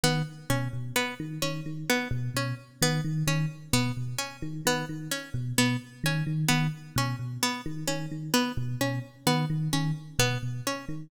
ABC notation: X:1
M:6/4
L:1/8
Q:1/4=130
K:none
V:1 name="Electric Piano 1" clef=bass
^D, z B,, B,, z D, D, D, z B,, B,, z | ^D, D, D, z B,, B,, z D, D, D, z B,, | B,, z ^D, D, D, z B,, B,, z D, D, D, | z B,, B,, z ^D, D, D, z B,, B,, z D, |]
V:2 name="Pizzicato Strings"
B, z ^C z B, z C z B, z C z | B, z ^C z B, z C z B, z C z | B, z ^C z B, z C z B, z C z | B, z ^C z B, z C z B, z C z |]